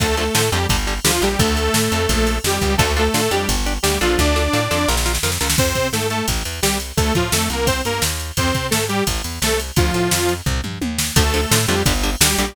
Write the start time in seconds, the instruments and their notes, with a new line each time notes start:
0.00 electric bass (finger) D2, overdriven guitar D3 F3 A3, lead 2 (sawtooth) A3 A4, kick, ride
0.17 overdriven guitar D3 F3 A3, lead 2 (sawtooth) A3 A4, ride
0.35 electric bass (finger) A2, overdriven guitar D3 F3 A3, snare
0.52 electric bass (finger) F2, overdriven guitar D3 F3 A3, lead 2 (sawtooth) G3 G4, ride
0.69 electric bass (finger) G1, overdriven guitar D3 G3, kick, ride
0.87 overdriven guitar D3 G3, ride
1.05 electric bass (finger) D2, overdriven guitar D3 G3, lead 2 (sawtooth) F3 F4, snare
1.22 electric bass (finger) A#1, overdriven guitar D3 G3, lead 2 (sawtooth) G3 G4, ride
1.39 electric bass (finger) D2, lead 2 (sawtooth) A3 A4, kick, ride
1.57 ride
1.74 electric bass (finger) A2, snare
1.92 electric bass (finger) F2, ride
2.09 electric bass (finger) A#1, kick, ride
2.27 ride
2.44 electric bass (finger) F2, lead 2 (sawtooth) G3 G4, snare
2.61 electric bass (finger) C#2, kick, ride
2.78 electric bass (finger) D2, lead 2 (sawtooth) A3 A4, overdriven guitar D4 F4 A4, kick, ride
2.97 lead 2 (sawtooth) A3 A4, overdriven guitar D4 F4 A4, ride
3.14 electric bass (finger) A2, overdriven guitar D4 F4 A4, snare
3.31 electric bass (finger) F2, lead 2 (sawtooth) G3 G4, overdriven guitar D4 G4, ride
3.49 electric bass (finger) G1, kick, ride
3.66 overdriven guitar D4 G4, ride
3.83 electric bass (finger) D2, lead 2 (sawtooth) G3 G4, overdriven guitar D4 G4, snare
4.01 electric bass (finger) A#1, lead 2 (sawtooth) F3 F4, overdriven guitar D4 F4 A4, ride
4.19 electric bass (finger) D2, lead 2 (sawtooth) D4 D5, kick, snare
4.36 overdriven guitar D4 F4 A4, snare
4.53 electric bass (finger) A2, overdriven guitar D4 F4 A4, snare
4.71 electric bass (finger) F2, overdriven guitar D4 F4 A4, snare
4.88 electric bass (finger) A#1, overdriven guitar F4 A#4, snare
4.97 snare
5.06 overdriven guitar F4 A#4, snare
5.15 snare
5.23 electric bass (finger) F2, overdriven guitar F4 A#4, snare
5.32 snare
5.41 electric bass (finger) C#2, overdriven guitar F4 A#4, snare
5.50 snare
5.58 electric bass (finger) F2, lead 2 (sawtooth) C4 C5, kick, crash
5.75 electric bass (finger) C3, kick, ride
5.93 electric bass (finger) G#2, lead 2 (sawtooth) A3 A4, snare
6.10 lead 2 (sawtooth) A3 A4, ride
6.28 electric bass (finger) A1, kick, ride
6.45 electric bass (finger) E2, ride
6.62 electric bass (finger) C2, lead 2 (sawtooth) G3 G4, snare
6.80 ride
6.97 electric bass (finger) D2, lead 2 (sawtooth) A3 A4, kick, ride
7.15 electric bass (finger) A2, lead 2 (sawtooth) F3 F4, kick, ride
7.32 electric bass (finger) F2, lead 2 (sawtooth) A3 A4, snare
7.50 electric bass (finger) C2, lead 2 (sawtooth) A#3 A#4, ride
7.67 lead 2 (sawtooth) C4 C5, kick, ride
7.85 electric bass (finger) G2, lead 2 (sawtooth) A#3 A#4, ride
8.02 electric bass (finger) D#2, snare
8.20 ride
8.37 electric bass (finger) F2, lead 2 (sawtooth) C4 C5, kick, ride
8.55 electric bass (finger) C3, kick, ride
8.71 electric bass (finger) G#2, lead 2 (sawtooth) A3 A4, snare
8.89 lead 2 (sawtooth) G3 G4, ride
9.07 electric bass (finger) A1, kick, ride
9.24 electric bass (finger) E2, ride
9.42 electric bass (finger) C2, lead 2 (sawtooth) A3 A4, snare
9.60 ride
9.76 electric bass (finger) D2, lead 2 (sawtooth) F3 F4, kick, ride
9.94 electric bass (finger) A2, ride
10.11 electric bass (finger) F2, snare
10.29 ride
10.46 electric bass (finger) C2, kick, floor tom
10.64 electric bass (finger) G2, mid tom
10.81 electric bass (finger) D#2, high tom
10.99 snare
11.16 electric bass (finger) D2, overdriven guitar D3 F3 A3, lead 2 (sawtooth) A3 A4, kick, ride
11.34 overdriven guitar D3 F3 A3, lead 2 (sawtooth) A3 A4, ride
11.51 electric bass (finger) A2, overdriven guitar D3 F3 A3, snare
11.67 electric bass (finger) F2, overdriven guitar D3 F3 A3, lead 2 (sawtooth) G3 G4, ride
11.86 electric bass (finger) G1, overdriven guitar D3 G3, kick, ride
12.03 overdriven guitar D3 G3, ride
12.20 electric bass (finger) D2, overdriven guitar D3 G3, lead 2 (sawtooth) G3 G4, snare
12.38 electric bass (finger) A#1, overdriven guitar D3 G3, lead 2 (sawtooth) G3 G4, ride